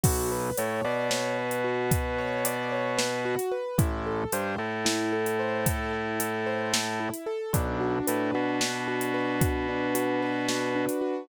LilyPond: <<
  \new Staff \with { instrumentName = "Acoustic Grand Piano" } { \time 7/8 \key b \phrygian \tempo 4 = 112 fis'8 b'8 cis''8 d''8 cis''8 b'8 fis'8 | b'8 cis''8 d''8 cis''8 b'8 fis'8 b'8 | e'8 a'8 c''8 a'8 e'8 a'8 c''8 | a'8 e'8 a'8 c''8 a'8 e'8 a'8 |
d'8 fis'8 b'8 fis'8 d'8 fis'8 b'8 | fis'8 d'8 fis'8 b'8 fis'8 d'8 fis'8 | }
  \new Staff \with { instrumentName = "Drawbar Organ" } { \clef bass \time 7/8 \key b \phrygian b,,4 a,8 b,2~ | b,2.~ b,8 | a,,4 g,8 a,2~ | a,2.~ a,8 |
b,,4 a,8 b,2~ | b,2.~ b,8 | }
  \new DrumStaff \with { instrumentName = "Drums" } \drummode { \time 7/8 <cymc bd>4 hh4 sn8. hh8. | <hh bd>4 hh4 sn8. hh8. | <hh bd>4 hh4 sn8. hh8. | <hh bd>4 hh4 sn8. hh8. |
<hh bd>4 hh4 sn8. hh8. | <hh bd>4 hh4 sn8. hh8. | }
>>